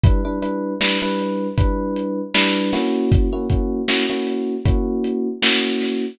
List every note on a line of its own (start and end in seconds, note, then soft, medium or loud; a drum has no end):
0.04 0.21 G3 medium
0.04 0.21 D4 medium
0.04 0.21 E4 medium
0.04 0.21 B4 medium
0.04 kick loud
0.04 closed hi-hat loud
0.25 0.39 G3 medium
0.25 0.39 D4 medium
0.25 0.39 E4 medium
0.25 0.39 B4 medium
0.42 0.74 G3 medium
0.42 0.74 D4 medium
0.42 0.74 E4 medium
0.42 0.74 B4 medium
0.42 closed hi-hat medium
0.81 0.98 G3 medium
0.81 0.98 D4 medium
0.81 0.98 E4 medium
0.81 0.98 B4 medium
0.81 snare loud
1.02 1.48 G3 medium
1.02 1.48 D4 medium
1.02 1.48 E4 medium
1.02 1.48 B4 medium
1.19 closed hi-hat medium
1.58 2.21 G3 medium
1.58 2.21 D4 medium
1.58 2.21 E4 medium
1.58 2.21 B4 medium
1.58 kick loud
1.58 closed hi-hat loud
1.96 closed hi-hat medium
2.34 2.71 G3 medium
2.34 2.71 D4 medium
2.34 2.71 E4 medium
2.34 2.71 B4 medium
2.34 snare loud
2.73 3.28 A#3 medium
2.73 3.28 C#4 medium
2.73 3.28 E4 loud
2.73 3.28 F#4 medium
2.73 snare medium
2.73 closed hi-hat medium
3.12 kick loud
3.12 closed hi-hat loud
3.33 3.46 A#3 medium
3.33 3.46 C#4 medium
3.33 3.46 E4 medium
3.33 3.46 F#4 medium
3.50 3.81 A#3 medium
3.50 3.81 C#4 medium
3.50 3.81 E4 medium
3.50 3.81 F#4 medium
3.50 kick medium
3.50 closed hi-hat medium
3.88 4.05 A#3 medium
3.88 4.05 C#4 medium
3.88 4.05 E4 medium
3.88 4.05 F#4 medium
3.88 snare loud
4.10 4.55 A#3 medium
4.10 4.55 C#4 medium
4.10 4.55 E4 medium
4.10 4.55 F#4 medium
4.27 closed hi-hat medium
4.65 5.28 A#3 medium
4.65 5.28 C#4 medium
4.65 5.28 E4 medium
4.65 5.28 F#4 medium
4.65 kick loud
4.65 closed hi-hat loud
5.04 closed hi-hat medium
5.42 6.05 A#3 medium
5.42 6.05 C#4 medium
5.42 6.05 E4 medium
5.42 6.05 F#4 medium
5.42 snare loud
5.80 snare medium
5.80 closed hi-hat medium